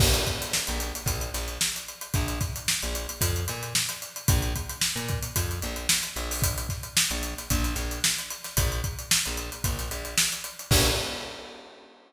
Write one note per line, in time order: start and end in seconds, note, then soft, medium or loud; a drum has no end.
0.00 0.24 A#1 medium
0.00 kick loud
0.00 crash loud
0.14 closed hi-hat medium
0.27 kick medium
0.27 closed hi-hat medium
0.42 closed hi-hat medium
0.53 snare medium
0.67 0.92 A#1 medium
0.67 snare soft
0.67 closed hi-hat medium
0.80 closed hi-hat medium
0.95 closed hi-hat medium
1.06 1.30 A#1 medium
1.06 kick medium
1.06 closed hi-hat medium
1.21 closed hi-hat medium
1.34 1.58 A#1 medium
1.34 snare soft
1.34 closed hi-hat medium
1.48 closed hi-hat medium
1.61 snare medium
1.76 closed hi-hat medium
1.88 closed hi-hat medium
2.01 closed hi-hat medium
2.14 2.39 A#1 medium
2.14 kick loud
2.14 closed hi-hat medium
2.28 closed hi-hat medium
2.40 kick medium
2.40 snare soft
2.40 closed hi-hat medium
2.56 closed hi-hat medium
2.68 snare medium
2.82 3.07 A#1 medium
2.82 closed hi-hat medium
2.95 closed hi-hat medium
3.09 closed hi-hat medium
3.21 3.45 F2 medium
3.21 kick medium
3.21 closed hi-hat loud
3.36 closed hi-hat medium
3.48 3.73 A#2 medium
3.48 closed hi-hat medium
3.63 closed hi-hat medium
3.75 snare loud
3.89 closed hi-hat medium
4.02 closed hi-hat medium
4.16 closed hi-hat medium
4.28 4.53 A#1 medium
4.28 kick loud
4.28 closed hi-hat loud
4.42 closed hi-hat medium
4.56 kick medium
4.56 closed hi-hat medium
4.69 closed hi-hat medium
4.81 snare medium
4.96 5.20 A#2 medium
4.96 closed hi-hat medium
5.08 kick medium
5.08 closed hi-hat medium
5.23 closed hi-hat medium
5.36 5.60 F2 medium
5.36 kick medium
5.36 closed hi-hat loud
5.51 closed hi-hat medium
5.62 5.87 A#1 medium
5.62 closed hi-hat medium
5.76 closed hi-hat medium
5.89 snare loud
6.03 closed hi-hat medium
6.16 6.67 A#1 medium
6.16 closed hi-hat medium
6.31 open hi-hat medium
6.42 kick medium
6.42 closed hi-hat loud
6.58 closed hi-hat medium
6.69 kick medium
6.69 snare soft
6.69 closed hi-hat medium
6.83 closed hi-hat medium
6.97 snare loud
7.11 7.34 A#1 medium
7.11 closed hi-hat medium
7.23 closed hi-hat medium
7.38 snare soft
7.38 closed hi-hat medium
7.50 7.75 A#1 medium
7.50 kick medium
7.50 closed hi-hat medium
7.64 closed hi-hat medium
7.75 8.00 A#1 medium
7.75 snare soft
7.75 closed hi-hat medium
7.91 closed hi-hat medium
8.04 snare loud
8.18 snare soft
8.18 closed hi-hat medium
8.30 closed hi-hat medium
8.44 snare soft
8.44 closed hi-hat medium
8.57 8.81 A#1 medium
8.57 kick medium
8.57 closed hi-hat loud
8.72 closed hi-hat medium
8.84 kick medium
8.84 closed hi-hat medium
8.99 closed hi-hat medium
9.11 snare loud
9.25 9.50 A#1 medium
9.25 closed hi-hat medium
9.37 closed hi-hat medium
9.52 closed hi-hat medium
9.64 9.89 A#1 medium
9.64 kick medium
9.64 closed hi-hat medium
9.79 snare soft
9.79 closed hi-hat medium
9.91 10.15 A#1 medium
9.91 closed hi-hat medium
10.05 closed hi-hat medium
10.18 snare loud
10.32 closed hi-hat medium
10.44 closed hi-hat medium
10.59 closed hi-hat medium
10.71 10.90 A#1 loud
10.71 kick loud
10.71 crash loud